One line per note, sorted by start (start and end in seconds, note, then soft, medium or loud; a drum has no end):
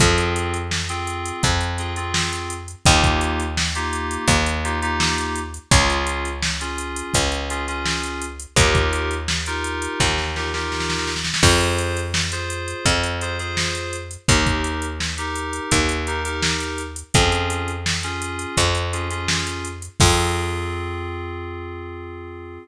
0.00 1.32 F2 loud
0.00 0.57 C4 loud
0.00 0.57 F4 loud
0.00 0.57 G#4 medium
0.00 kick loud
0.00 closed hi-hat medium
0.18 closed hi-hat medium
0.36 closed hi-hat medium
0.54 closed hi-hat medium
0.71 snare loud
0.89 1.46 C4 medium
0.89 1.46 F4 medium
0.89 1.46 G#4 medium
0.89 closed hi-hat medium
1.07 closed hi-hat medium
1.26 closed hi-hat medium
1.43 2.75 F2 medium
1.43 kick medium
1.43 closed hi-hat medium
1.61 closed hi-hat medium
1.78 1.93 C4 medium
1.78 1.93 F4 medium
1.78 1.93 G#4 medium
1.78 closed hi-hat medium
1.96 2.54 C4 medium
1.96 2.54 F4 medium
1.96 2.54 G#4 medium
1.96 closed hi-hat medium
2.14 snare loud
2.33 closed hi-hat medium
2.50 closed hi-hat medium
2.68 closed hi-hat medium
2.86 4.18 D#2 loud
2.86 3.43 A#3 loud
2.86 3.43 D#4 medium
2.86 3.43 F4 loud
2.86 3.43 G4 loud
2.86 kick loud
2.86 closed hi-hat medium
3.03 kick medium
3.03 closed hi-hat medium
3.21 closed hi-hat medium
3.40 closed hi-hat medium
3.57 snare loud
3.75 4.32 A#3 medium
3.75 4.32 D#4 medium
3.75 4.32 F4 medium
3.75 4.32 G4 medium
3.75 closed hi-hat medium
3.93 closed hi-hat medium
4.11 closed hi-hat medium
4.28 5.59 D#2 loud
4.28 kick medium
4.28 closed hi-hat medium
4.46 closed hi-hat medium
4.64 4.78 A#3 medium
4.64 4.78 D#4 medium
4.64 4.78 F4 medium
4.64 4.78 G4 medium
4.64 closed hi-hat medium
4.82 5.39 A#3 medium
4.82 5.39 D#4 medium
4.82 5.39 F4 medium
4.82 5.39 G4 loud
4.82 closed hi-hat medium
5.00 snare loud
5.18 closed hi-hat medium
5.36 closed hi-hat medium
5.54 closed hi-hat medium
5.71 7.03 C#2 loud
5.71 6.29 C#4 loud
5.71 6.29 F4 loud
5.71 6.29 G#4 loud
5.71 kick loud
5.71 closed hi-hat loud
5.90 closed hi-hat medium
6.07 closed hi-hat medium
6.25 closed hi-hat medium
6.42 snare loud
6.61 7.18 C#4 medium
6.61 7.18 F4 medium
6.61 7.18 G#4 medium
6.61 closed hi-hat medium
6.78 closed hi-hat medium
6.96 closed hi-hat medium
7.14 8.46 C#2 medium
7.14 kick medium
7.14 closed hi-hat loud
7.32 closed hi-hat medium
7.50 7.64 C#4 medium
7.50 7.64 F4 medium
7.50 7.64 G#4 medium
7.50 closed hi-hat medium
7.68 8.25 C#4 medium
7.68 8.25 F4 medium
7.68 8.25 G#4 medium
7.68 closed hi-hat medium
7.86 snare loud
8.03 closed hi-hat medium
8.22 closed hi-hat medium
8.40 closed hi-hat medium
8.56 9.88 D#2 loud
8.56 9.14 D#4 medium
8.56 9.14 F4 medium
8.56 9.14 G4 loud
8.56 9.14 A#4 loud
8.56 kick loud
8.56 closed hi-hat loud
8.75 kick medium
8.75 closed hi-hat medium
8.93 closed hi-hat medium
9.11 closed hi-hat medium
9.28 snare loud
9.46 10.04 D#4 medium
9.46 10.04 F4 medium
9.46 10.04 G4 medium
9.46 10.04 A#4 medium
9.46 closed hi-hat medium
9.64 closed hi-hat medium
9.82 closed hi-hat medium
10.00 11.32 D#2 medium
10.00 kick medium
10.00 snare medium
10.18 snare medium
10.36 10.50 D#4 medium
10.36 10.50 F4 medium
10.36 10.50 G4 medium
10.36 10.50 A#4 medium
10.36 snare medium
10.54 11.11 D#4 medium
10.54 11.11 F4 medium
10.54 11.11 G4 medium
10.54 11.11 A#4 medium
10.54 snare medium
10.72 snare medium
10.80 snare medium
10.90 snare medium
10.99 snare medium
11.07 snare medium
11.16 snare medium
11.24 snare medium
11.34 snare loud
11.43 12.74 F2 loud
11.43 12.00 F4 loud
11.43 12.00 G#4 loud
11.43 12.00 C5 medium
11.43 kick loud
11.43 crash loud
11.61 closed hi-hat medium
11.78 closed hi-hat medium
11.97 closed hi-hat medium
12.14 snare loud
12.32 12.89 F4 medium
12.32 12.89 G#4 medium
12.32 12.89 C5 medium
12.32 closed hi-hat medium
12.50 closed hi-hat medium
12.68 closed hi-hat medium
12.85 14.17 F2 medium
12.85 kick medium
12.85 closed hi-hat loud
13.04 closed hi-hat medium
13.21 13.36 F4 medium
13.21 13.36 G#4 medium
13.21 13.36 C5 medium
13.21 closed hi-hat medium
13.39 13.96 F4 medium
13.39 13.96 G#4 medium
13.39 13.96 C5 medium
13.39 closed hi-hat medium
13.57 snare loud
13.75 closed hi-hat medium
13.93 closed hi-hat medium
14.11 closed hi-hat medium
14.28 15.60 D#2 loud
14.28 14.86 D#4 medium
14.28 14.86 G4 medium
14.28 14.86 A#4 medium
14.28 kick loud
14.28 closed hi-hat loud
14.46 kick medium
14.46 closed hi-hat medium
14.64 closed hi-hat medium
14.82 closed hi-hat medium
15.00 snare medium
15.18 15.75 D#4 medium
15.18 15.75 G4 medium
15.18 15.75 A#4 medium
15.18 closed hi-hat medium
15.36 closed hi-hat medium
15.53 closed hi-hat medium
15.71 17.03 D#2 medium
15.71 kick medium
15.71 closed hi-hat loud
15.89 closed hi-hat medium
16.07 16.21 D#4 medium
16.07 16.21 G4 medium
16.07 16.21 A#4 medium
16.07 closed hi-hat medium
16.25 16.82 D#4 medium
16.25 16.82 G4 medium
16.25 16.82 A#4 medium
16.25 closed hi-hat medium
16.42 snare loud
16.60 closed hi-hat medium
16.78 closed hi-hat medium
16.96 closed hi-hat medium
17.14 18.46 F2 loud
17.14 17.71 C#4 loud
17.14 17.71 F4 medium
17.14 17.71 G#4 loud
17.14 kick loud
17.14 closed hi-hat loud
17.32 closed hi-hat medium
17.50 closed hi-hat medium
17.68 closed hi-hat medium
17.86 snare loud
18.03 18.61 C#4 medium
18.03 18.61 F4 medium
18.03 18.61 G#4 medium
18.03 closed hi-hat medium
18.22 closed hi-hat medium
18.39 closed hi-hat medium
18.57 19.89 F2 medium
18.57 kick medium
18.57 closed hi-hat loud
18.75 closed hi-hat medium
18.93 19.07 C#4 medium
18.93 19.07 F4 medium
18.93 19.07 G#4 medium
18.93 closed hi-hat medium
19.10 19.68 C#4 medium
19.10 19.68 F4 medium
19.10 19.68 G#4 medium
19.10 closed hi-hat medium
19.28 snare loud
19.47 closed hi-hat medium
19.65 closed hi-hat medium
19.82 closed hi-hat medium
20.00 22.58 F2 loud
20.00 22.58 C4 medium
20.00 22.58 F4 loud
20.00 22.58 G#4 loud
20.00 kick loud
20.00 crash loud